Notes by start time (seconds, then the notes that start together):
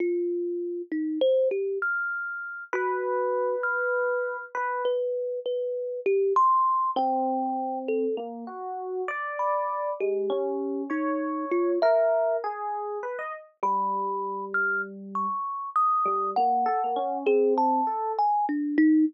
0.00 F4
0.92 D#4
1.21 C5
1.51 G4
1.82 F6
2.73 F#4 B4
3.63 F6
4.55 B4
4.85 B4
5.46 B4
6.06 G4
6.36 C6
6.96 C4 G5
7.88 A4
8.17 A#3
8.47 F#4
9.08 D5
9.39 B5
10.00 G#3 G4
10.30 C#4
10.90 D#4 C#5
11.51 F4
11.82 A#4 E5
12.44 G#4
13.03 B4
13.19 D#5
13.63 G3 B5
14.54 F6
15.15 C#6
15.76 D#6
16.06 G3
16.36 A#3 F#5
16.66 A4
16.84 A#3
16.96 C#4
17.26 C4 G#4
17.58 A5
17.87 A4
18.19 G#5
18.49 D4
18.78 D#4